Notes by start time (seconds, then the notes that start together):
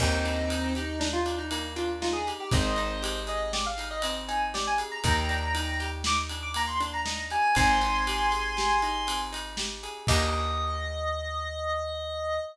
0.00 D#2 A#3 C4 D#4, kick, crash
0.25 D4, ride
0.50 D#4, ride
0.75 D#4 G4, ride
1.00 D4 D#4, snare
1.13 F4
1.26 D4, ride
1.38 D#4
1.51 A#3 D#4, ride
1.76 D4 F4, ride
2.01 D#4 F4, snare
2.13 G#4
2.27 G4, ride
2.40 G4
2.51 G#1 C4 C5 D#5, kick, ride
2.76 D#4, ride
3.02 G4, ride
3.27 G#4 D#5, ride
3.53 G4 D5, snare
3.66 F5
3.78 D#4, ride
3.91 D#5
4.02 C4 D#5, ride
4.28 D#4 G#5, ride
4.54 G4 D5, snare
4.67 G#5
4.78 G#4, ride
4.91 A#5
5.04 D#2 A#3 G5 A#5, kick, ride
5.29 D4, ride
5.55 D#4, ride
5.80 G4, ride
6.04 D#4 D6, snare
6.29 D4, ride
6.42 D6
6.54 A#3 A#5, ride
6.67 C6
6.80 D4, ride
6.93 A#5
7.06 D#4, snare
7.30 G4 G#5, ride
7.55 G#1 C4 G#5 C6, kick, ride
7.81 D#4, ride
8.07 G4, ride
8.32 G#4, ride
8.57 G4, snare
8.82 D#4, ride
9.07 C4, ride
9.33 D#4, ride
9.57 G4, snare
9.83 G#4, ride
10.07 D#2 A#3 D4 D#4 G4 D#5, kick, crash